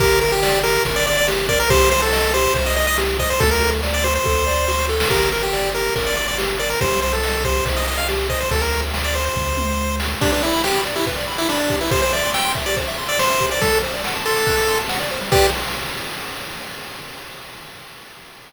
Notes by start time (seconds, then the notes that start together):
0.00 G1 G4 A#4, kick, ride
0.21 A#4, ride
0.32 G4
0.43 D5, snare
0.63 G4 A#4, ride
0.85 G1 A#4, kick, ride
0.96 D5
1.06 D5, ride
1.17 D5
1.28 G4, snare
1.49 A#4 D5, kick, ride
1.60 A#4
1.69 C2 G4 C5, kick, ride
1.91 C5, ride
2.02 A4
2.13 D#5, snare
2.34 G4 C5, ride
2.54 C2 C5, kick, ride
2.66 D#5
2.76 D#5, ride
2.87 D#5
2.98 G4, snare
3.19 C5 D#5, kick, ride
3.30 C5
3.40 D2 F#4 A4, kick, ride
3.51 A#4
3.62 A4, ride
3.83 D5, snare
3.94 D5
4.04 F#4 C5, ride
4.15 C5
4.25 D2 A4, kick, snare
4.47 D5, snare
4.68 F#4, snare
4.78 snare
4.89 A4, snare
5.00 snare
5.10 G1 G4 A#4, kick, crash
5.32 A#4, ride
5.43 G4
5.53 D5, snare
5.75 G4 A#4, ride
5.96 G1 A#4, kick, ride
6.07 D5
6.17 D5, ride
6.28 D5
6.38 G4, snare
6.59 A#4 D5, ride
6.70 A#4
6.81 C2 G4 C5, kick, ride
7.02 C5, ride
7.13 A4
7.23 D#5, snare
7.44 G4 C5, kick, ride
7.65 C2 C5, kick, ride
7.76 D#5
7.87 D#5, ride
7.98 F5
8.08 G4, snare
8.30 C5 D#5, kick, ride
8.41 C5
8.51 D2 A4, kick, ride
8.61 A#4
8.73 ride
8.94 snare
9.04 D5
9.15 C5, ride
9.26 C5
9.36 D2, kick, floor tom
9.57 mid tom
10.00 snare
10.21 D4 G4, kick, crash
10.32 D4 B4, ride
10.42 E4 D5, ride
10.53 B5, ride
10.64 G4 D6, snare
10.74 B5, ride
10.85 D5, ride
10.95 E4 G4, ride
11.06 B4, kick, ride
11.17 D5, ride
11.28 B5, ride
11.38 E4 D6, ride
11.49 D4 B5, snare
11.59 D5, ride
11.70 G4, kick, ride
11.81 E4 B4, ride
11.91 G4 C5, kick, ride
12.02 C5, ride
12.13 D5 E5, ride
12.23 C6, ride
12.34 G5 E6, snare
12.45 C6, ride
12.55 E5, kick, ride
12.66 G4 D5, ride
12.76 C5, kick, ride
12.87 E5, ride
12.98 C6, ride
13.08 D5 E6, ride
13.19 C5 C6, snare
13.30 E5, ride
13.40 G4, kick, ride
13.51 C5 D5, ride
13.61 G3 A4, kick, ride
13.72 A4, ride
13.83 C5, ride
13.94 D5, ride
14.04 F#5, snare
14.15 A5, ride
14.25 A4 C6, ride
14.36 D6, ride
14.47 F#6, kick, ride
14.57 D6, ride
14.68 C6, ride
14.79 A5, ride
14.89 F#5, snare
15.00 D5, ride
15.11 C5, ride
15.21 G3, ride
15.32 G4 B4 D5, kick, crash